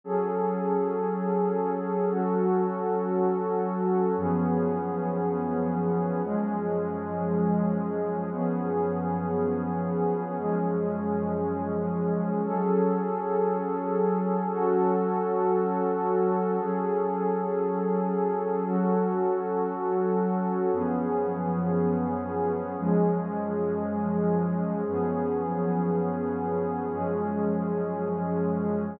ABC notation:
X:1
M:4/4
L:1/8
Q:1/4=58
K:F#dor
V:1 name="Pad 2 (warm)"
[F,CGA]4 [F,CFA]4 | [F,,^E,B,CG]4 [F,,E,G,CG]4 | [F,,^E,B,CG]4 [F,,E,G,CG]4 | [F,CGA]4 [F,CFA]4 |
[F,CGA]4 [F,CFA]4 | [F,,^E,B,CG]4 [F,,E,G,CG]4 | [F,,^E,B,CG]4 [F,,E,G,CG]4 |]